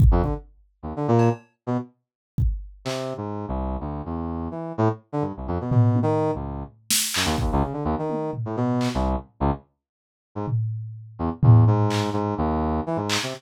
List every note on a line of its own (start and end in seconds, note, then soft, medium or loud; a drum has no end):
0.00 kick loud
0.11 0.22 F2 loud
0.23 0.34 D3 medium
0.23 kick medium
0.83 0.93 D#2 medium
0.96 1.07 D3 medium
1.08 1.29 A#2 loud
1.19 cowbell medium
1.67 1.77 B2 medium
2.38 kick medium
2.85 3.14 C3 medium
2.85 clap medium
3.17 3.46 G#2 medium
3.48 3.77 C2 medium
3.80 4.02 D2 medium
4.05 4.48 E2 medium
4.51 4.73 E3 soft
4.78 4.88 A2 loud
5.12 5.23 D3 medium
5.22 5.32 G2 medium
5.37 5.48 C2 medium
5.48 5.58 F2 medium
5.61 5.70 B2 medium
5.71 5.99 B2 medium
5.71 floor tom loud
5.95 high tom medium
6.03 6.31 D#3 loud
6.35 6.63 C#2 medium
6.90 snare loud
7.14 7.26 F#2 medium
7.14 clap loud
7.25 7.36 D#2 loud
7.38 7.51 D#2 medium
7.38 kick medium
7.52 7.63 C#2 loud
7.62 7.73 C#3 medium
7.73 7.84 D3 medium
7.85 7.95 D#2 loud
7.99 8.31 D#3 medium
8.10 high tom medium
8.33 floor tom medium
8.45 8.56 A2 medium
8.56 8.89 B2 medium
8.81 clap medium
8.94 9.16 C2 loud
9.40 9.51 C#2 loud
10.35 10.46 G#2 medium
10.48 floor tom medium
11.19 11.30 E2 medium
11.43 11.65 E2 medium
11.43 floor tom loud
11.67 12.10 G#2 medium
11.90 clap medium
12.13 12.34 G#2 medium
12.38 12.80 D#2 loud
12.86 12.97 E3 medium
12.96 13.18 G#2 medium
13.10 clap loud
13.23 13.34 C3 medium